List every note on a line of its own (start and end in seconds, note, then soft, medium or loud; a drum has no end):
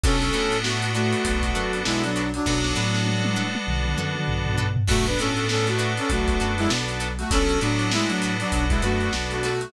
0.04 0.31 B1 loud
0.04 2.23 B3 loud
0.04 0.57 C#4 medium
0.04 0.16 D4 medium
0.04 2.23 D4 loud
0.04 2.23 F#4 loud
0.04 0.16 F#4 medium
0.04 2.23 A4 loud
0.04 0.57 A4 medium
0.04 0.16 A4 medium
0.04 0.16 B4 medium
0.04 kick loud
0.04 closed hi-hat loud
0.22 closed hi-hat medium
0.33 1.14 A2 medium
0.33 0.56 D4 medium
0.33 0.56 F#4 medium
0.33 0.56 A4 medium
0.33 0.56 B4 medium
0.33 snare medium
0.33 closed hi-hat medium
0.52 closed hi-hat medium
0.63 0.91 A3 medium
0.63 0.91 F#4 medium
0.63 snare loud
0.82 closed hi-hat medium
0.94 1.80 A3 medium
0.94 1.18 D4 medium
0.94 1.80 F#4 medium
0.94 1.18 F#4 medium
0.94 1.18 A4 medium
0.94 1.18 B4 medium
0.94 closed hi-hat medium
1.13 closed hi-hat medium
1.25 1.52 B1 medium
1.25 kick medium
1.25 closed hi-hat loud
1.43 kick medium
1.43 closed hi-hat medium
1.55 1.82 F#2 medium
1.55 1.78 D4 medium
1.55 1.78 F#4 medium
1.55 1.78 A4 medium
1.55 1.78 B4 medium
1.55 snare soft
1.55 closed hi-hat medium
1.73 closed hi-hat medium
1.85 2.39 B1 medium
1.85 2.02 G#3 medium
1.85 2.02 E4 medium
1.85 snare loud
2.04 2.31 F#3 medium
2.04 2.31 D4 medium
2.04 snare soft
2.04 closed hi-hat medium
2.16 2.29 D4 medium
2.16 2.29 F#4 medium
2.16 2.29 A4 medium
2.16 2.29 B4 medium
2.16 closed hi-hat medium
2.34 2.46 F#3 medium
2.34 2.46 D4 medium
2.34 closed hi-hat medium
2.46 2.73 B1 loud
2.46 3.45 F#3 medium
2.46 4.66 B3 loud
2.46 2.59 D4 loud
2.46 3.45 D4 medium
2.46 4.66 D4 loud
2.46 4.66 F#4 loud
2.46 2.59 F#4 medium
2.46 4.66 A4 loud
2.46 2.59 A4 medium
2.46 2.59 B4 medium
2.46 kick medium
2.46 snare medium
2.64 snare medium
2.76 3.57 A2 medium
2.76 2.98 D4 medium
2.76 2.98 F#4 medium
2.76 2.98 A4 medium
2.76 2.98 B4 medium
2.76 snare medium
2.94 snare medium
3.07 high tom medium
3.25 high tom loud
3.36 3.59 D4 medium
3.36 3.59 F#4 medium
3.36 3.59 A4 medium
3.36 3.59 B4 medium
3.55 high tom medium
3.67 3.95 B1 medium
3.67 mid tom medium
3.85 mid tom medium
3.98 4.25 F#2 medium
3.98 4.21 D4 medium
3.98 4.21 F#4 medium
3.98 4.21 A4 medium
3.98 4.21 B4 medium
3.98 mid tom medium
4.16 mid tom medium
4.28 4.82 B1 medium
4.28 floor tom loud
4.46 floor tom loud
4.57 4.70 D4 medium
4.57 4.70 F#4 medium
4.57 4.70 A4 medium
4.57 4.70 B4 medium
4.57 floor tom loud
4.76 floor tom loud
4.88 5.15 B1 medium
4.88 5.05 A3 medium
4.88 7.08 B3 loud
4.88 5.00 D4 medium
4.88 7.08 D4 loud
4.88 5.00 F#4 medium
4.88 7.08 F#4 loud
4.88 5.05 F#4 medium
4.88 7.08 A4 loud
4.88 5.00 A4 medium
4.88 5.00 B4 medium
4.88 kick loud
4.88 crash loud
5.06 5.18 D4 medium
5.06 5.18 B4 medium
5.06 closed hi-hat medium
5.19 5.99 A2 medium
5.19 5.46 C#4 medium
5.19 5.43 D4 medium
5.19 5.43 F#4 medium
5.19 5.46 A4 medium
5.19 5.43 A4 medium
5.19 5.43 B4 medium
5.19 snare medium
5.19 closed hi-hat medium
5.37 closed hi-hat medium
5.49 5.67 C#4 medium
5.49 5.67 A4 medium
5.49 snare loud
5.67 5.93 A3 medium
5.67 5.93 F#4 medium
5.67 closed hi-hat medium
5.79 6.02 D4 medium
5.79 6.02 F#4 medium
5.79 6.02 A4 medium
5.79 6.02 B4 medium
5.79 snare soft
5.79 closed hi-hat medium
5.97 6.10 C#4 medium
5.97 6.10 A4 medium
5.97 snare soft
5.97 closed hi-hat medium
6.10 6.37 B1 medium
6.10 6.55 A3 medium
6.10 6.55 F#4 medium
6.10 kick medium
6.10 closed hi-hat loud
6.28 kick medium
6.28 closed hi-hat medium
6.40 6.67 F#2 medium
6.40 6.64 D4 medium
6.40 6.64 F#4 medium
6.40 6.64 A4 medium
6.40 6.64 B4 medium
6.40 closed hi-hat medium
6.58 6.69 G#3 medium
6.58 6.69 E4 medium
6.58 closed hi-hat medium
6.70 7.24 B1 medium
6.70 snare loud
6.88 closed hi-hat medium
7.00 7.13 D4 medium
7.00 7.13 F#4 medium
7.00 7.13 A4 medium
7.00 7.13 B4 medium
7.00 closed hi-hat medium
7.19 7.31 A3 medium
7.19 7.31 F#4 medium
7.19 closed hi-hat medium
7.31 7.58 B1 medium
7.31 9.51 B3 loud
7.31 7.59 C#4 medium
7.31 7.44 D4 medium
7.31 9.51 D4 loud
7.31 9.51 F#4 loud
7.31 7.44 F#4 medium
7.31 9.51 A4 loud
7.31 7.59 A4 medium
7.31 7.44 A4 medium
7.31 7.44 B4 medium
7.31 kick loud
7.31 closed hi-hat loud
7.49 closed hi-hat medium
7.61 8.42 A2 medium
7.61 7.91 F#3 medium
7.61 7.84 D4 medium
7.61 7.91 D4 medium
7.61 7.84 F#4 medium
7.61 7.84 A4 medium
7.61 7.84 B4 medium
7.61 snare medium
7.61 closed hi-hat medium
7.79 closed hi-hat medium
7.92 8.09 G#3 medium
7.92 8.09 E4 medium
7.92 snare loud
8.08 8.35 F#3 medium
8.08 8.35 D4 medium
8.08 closed hi-hat medium
8.22 8.46 D4 medium
8.22 8.46 F#4 medium
8.22 8.46 A4 medium
8.22 8.46 B4 medium
8.22 closed hi-hat medium
8.40 8.65 F#3 medium
8.40 8.65 D4 medium
8.40 closed hi-hat medium
8.52 8.79 B1 medium
8.52 kick medium
8.52 closed hi-hat loud
8.69 8.81 G#3 medium
8.69 8.81 E4 medium
8.69 kick loud
8.69 closed hi-hat medium
8.82 9.09 F#2 medium
8.82 9.13 A3 medium
8.82 9.05 D4 medium
8.82 9.05 F#4 medium
8.82 9.13 F#4 medium
8.82 9.05 A4 medium
8.82 9.05 B4 medium
8.82 closed hi-hat medium
9.01 closed hi-hat medium
9.13 9.66 B1 medium
9.13 snare loud
9.30 9.42 A3 soft
9.30 9.42 F#4 medium
9.30 closed hi-hat medium
9.43 9.71 A3 medium
9.43 9.56 D4 medium
9.43 9.71 F#4 medium
9.43 9.56 F#4 medium
9.43 9.56 A4 medium
9.43 9.56 B4 medium
9.43 closed hi-hat medium
9.61 closed hi-hat medium